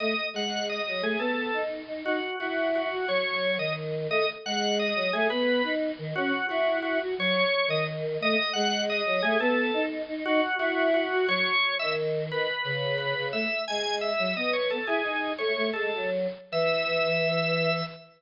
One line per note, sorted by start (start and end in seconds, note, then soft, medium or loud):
0.00 0.15 A3 medium
0.00 0.27 D#5 medium
0.34 0.81 G#3 medium
0.34 0.65 F#5 medium
0.69 1.02 D#5 medium
0.87 1.02 F#3 medium
1.02 1.16 A3 loud
1.02 1.19 G#4 medium
1.19 1.51 B3 medium
1.19 1.62 A4 medium
1.53 1.82 D#4 medium
1.87 2.03 D#4 medium
2.05 2.20 D#4 loud
2.05 2.36 F#4 medium
2.40 2.88 E4 medium
2.40 2.68 F#4 medium
2.75 3.08 F#4 medium
2.91 3.05 F#4 medium
3.08 3.58 F#3 medium
3.08 3.55 C#5 loud
3.58 4.07 D#3 medium
3.58 3.73 D#5 medium
4.10 4.25 A3 loud
4.10 4.28 D#5 loud
4.45 4.92 G#3 medium
4.45 4.75 F#5 medium
4.79 5.12 D#5 medium
4.95 5.10 F#3 medium
5.13 5.28 A3 loud
5.13 5.29 G#4 loud
5.30 5.62 B3 loud
5.30 5.72 B4 loud
5.63 5.91 D#4 medium
5.98 6.14 D#3 medium
6.15 6.32 C#4 loud
6.15 6.46 F#4 loud
6.49 6.98 E4 loud
6.49 6.77 F#4 medium
6.82 6.99 F#4 medium
7.01 7.15 F#4 medium
7.18 7.44 F#3 loud
7.18 7.67 C#5 loud
7.68 8.18 D#3 medium
7.68 7.84 D#5 loud
8.21 8.36 A3 loud
8.21 8.50 D#5 loud
8.53 9.02 G#3 loud
8.53 8.83 F#5 loud
8.89 9.22 D#5 loud
9.05 9.21 F#3 medium
9.22 9.37 A3 loud
9.22 9.38 G#4 loud
9.40 9.71 B3 loud
9.40 9.83 A4 loud
9.74 10.02 D#4 loud
10.08 10.24 D#4 loud
10.25 10.41 D#4 loud
10.25 10.56 F#4 loud
10.59 11.08 E4 loud
10.59 10.88 F#4 loud
10.94 11.27 F#4 medium
11.12 11.26 F#4 loud
11.28 11.54 F#3 loud
11.28 11.75 C#5 loud
11.79 12.30 D#3 medium
11.79 11.93 E5 loud
12.31 12.47 D#3 medium
12.31 12.95 B4 medium
12.64 13.14 C#3 medium
12.98 13.26 B4 medium
13.17 13.32 C#3 medium
13.33 13.47 A3 medium
13.33 13.62 E5 medium
13.68 14.12 G#3 medium
13.68 13.96 G#5 medium
14.01 14.34 E5 medium
14.19 14.34 F#3 medium
14.36 14.78 B3 medium
14.36 14.53 D#5 loud
14.53 14.68 C#5 medium
14.70 14.86 A4 medium
14.87 15.02 E4 medium
14.87 15.31 G#4 loud
15.04 15.32 D#4 medium
15.38 15.53 A3 medium
15.38 15.67 C#5 medium
15.56 15.71 A3 medium
15.73 15.91 G#3 medium
15.73 16.07 A4 medium
15.93 16.27 F#3 medium
16.52 17.83 E3 loud
16.52 17.83 E5 loud